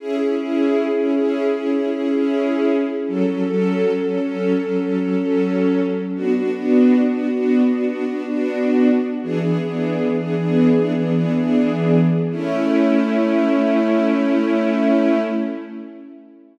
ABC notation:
X:1
M:4/4
L:1/16
Q:1/4=78
K:A
V:1 name="String Ensemble 1"
[CEG] [CEG] [CEG]3 [CEG] [CEG]2 [CEG] [CEG] [CEG] [CEG]5 | [F,CA] [F,CA] [F,CA]3 [F,CA] [F,CA]2 [F,CA] [F,CA] [F,CA] [F,CA]5 | [B,DF] [B,DF] [B,DF]3 [B,DF] [B,DF]2 [B,DF] [B,DF] [B,DF] [B,DF]5 | [E,B,DG] [E,B,DG] [E,B,DG]3 [E,B,DG] [E,B,DG]2 [E,B,DG] [E,B,DG] [E,B,DG] [E,B,DG]5 |
[A,CE]16 |]